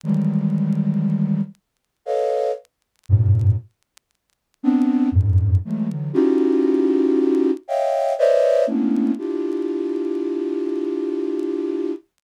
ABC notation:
X:1
M:3/4
L:1/16
Q:1/4=59
K:none
V:1 name="Flute"
[_E,=E,_G,=G,_A,]6 z2 [=AB_d_ef]2 z2 | [_G,,=G,,_A,,=A,,B,,]2 z4 [B,CD]2 [F,,_G,,_A,,]2 [E,_G,_A,=A,] [D,E,G,] | [_D_E=EF_G=G]6 [_d_e=efg]2 [Bcd=d_e=e]2 [A,_B,=B,_D=DE]2 | [DEFG]12 |]